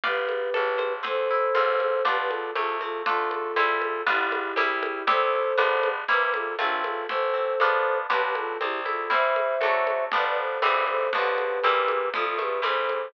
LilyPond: <<
  \new Staff \with { instrumentName = "Flute" } { \time 2/4 \key c \major \tempo 4 = 119 <g' b'>2 | <a' c''>2 | <g' b'>16 <g' b'>16 <f' a'>8 <f' a'>8 <f' a'>8 | <f' a'>2 |
<e' g'>2 | <a' c''>2 | b'16 b'16 <f' a'>8 <d' f'>8 <f' a'>8 | <a' c''>2 |
<g' b'>16 <g' b'>16 <f' a'>8 <e' g'>8 <f' a'>8 | <c'' e''>2 | <b' d''>16 <b' d''>16 <a' c''>8 <a' c''>8 <a' c''>8 | <g' b'>2 |
<f' a'>16 <f' a'>16 <g' b'>8 <a' c''>4 | }
  \new Staff \with { instrumentName = "Orchestral Harp" } { \time 2/4 \key c \major <b' d'' f'' g''>4 a'8 c''8 | c'8 e'8 <c' f' a'>4 | <b d' f'>4 a8 c'8 | <a d' f'>4 <g c' e'>4 |
<g b d' f'>4 <g c' e'>4 | <g c' e'>4 <g b d' f'>4 | <g bes c' e'>4 <a c' f'>4 | a8 c'8 <b d' f'>4 |
<b d' f' g'>4 c'8 e'8 | <g c' e'>4 <fis a d'>4 | <f g b d'>4 <e g c'>4 | <d f b>4 <e g bes c'>4 |
f8 a8 <e g c'>4 | }
  \new Staff \with { instrumentName = "Electric Bass (finger)" } { \clef bass \time 2/4 \key c \major g,,4 a,,4 | e,4 a,,4 | b,,4 c,4 | d,4 c,4 |
g,,4 c,4 | c,4 g,,4 | c,4 a,,4 | a,,4 f,4 |
b,,4 c,4 | e,4 d,4 | g,,4 g,,4 | b,,4 c,4 |
c,4 c,4 | }
  \new DrumStaff \with { instrumentName = "Drums" } \drummode { \time 2/4 cgl8 cgho8 cgho8 cgho8 | cgl4 cgho8 cgho8 | cgl8 cgho8 cgho8 cgho8 | cgl8 cgho8 cgho8 cgho8 |
cgl8 cgho8 cgho8 cgho8 | cgl4 cgho8 cgho8 | cgl8 cgho8 cgho8 cgho8 | cgl4 cgho4 |
cgl8 cgho8 cgho8 cgho8 | cgl8 cgho8 cgho8 cgho8 | cgl4 cgho8 cgho8 | cgl8 cgho8 cgho8 cgho8 |
cgl8 cgho8 cgho8 cgho8 | }
>>